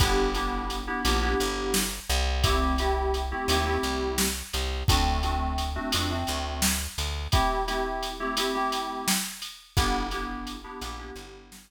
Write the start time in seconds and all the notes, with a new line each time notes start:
0.00 G1 B3 D4 E4 G4, kick, ride
0.35 B3 D4 E4 G4, ride
0.70 ride
0.87 B3 D4 E4 G4
1.05 A#1 B3 D4 E4 G4, ride
1.22 B3 D4 E4 G4
1.40 G1, ride
1.74 snare
2.09 C2, ride
2.44 A3 C4 E4 G4, kick, ride
2.78 A3 C4 E4 G4, ride
3.14 ride
3.31 A3 C4 E4 G4
3.48 D#2 A3 C4 E4 G4, ride
3.66 A3 C4 E4 G4
3.83 C2, ride
4.18 snare
4.53 C2, ride
4.88 D2 A3 C4 D4 F#4, kick, ride
5.23 A3 C4 D4 F#4, ride
5.58 ride
5.76 A3 C4 D4 F#4
5.92 F2 A3 C4 D4 F#4, ride
6.10 A3 C4 D4 F#4
6.27 D2, ride
6.62 snare
6.98 D2, ride
7.32 A3 C4 E4 G4, kick, ride
7.67 A3 C4 E4 G4, ride
8.03 ride
8.20 A3 C4 E4 G4
8.37 A3 C4 E4 G4, ride
8.55 A3 C4 E4 G4
8.72 ride
9.08 snare
9.42 ride
9.77 G1 B3 D4 E4 G4, kick, ride
10.11 B3 D4 E4 G4, ride
10.47 ride
10.64 B3 D4 E4 G4
10.81 A#1 B3 D4 E4 G4, ride
10.99 B3 D4 E4 G4
11.16 G1, ride
11.52 snare